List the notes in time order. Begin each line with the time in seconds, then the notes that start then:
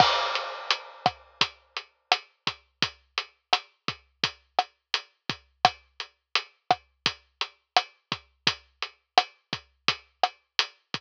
0.00 kick, cross-stick, crash
0.35 closed hi-hat
0.70 closed hi-hat
1.06 kick, cross-stick, closed hi-hat
1.41 kick, closed hi-hat
1.76 closed hi-hat
2.12 cross-stick, closed hi-hat
2.47 kick, closed hi-hat
2.82 kick, closed hi-hat
3.18 closed hi-hat
3.53 cross-stick, closed hi-hat
3.88 kick, closed hi-hat
4.24 kick, closed hi-hat
4.59 cross-stick, closed hi-hat
4.94 closed hi-hat
5.29 kick, closed hi-hat
5.65 kick, cross-stick, closed hi-hat
6.00 closed hi-hat
6.35 closed hi-hat
6.71 kick, cross-stick, closed hi-hat
7.06 kick, closed hi-hat
7.41 closed hi-hat
7.76 cross-stick, closed hi-hat
8.12 kick, closed hi-hat
8.47 kick, closed hi-hat
8.82 closed hi-hat
9.18 cross-stick, closed hi-hat
9.53 kick, closed hi-hat
9.88 kick, closed hi-hat
10.23 cross-stick, closed hi-hat
10.59 closed hi-hat
10.94 kick, closed hi-hat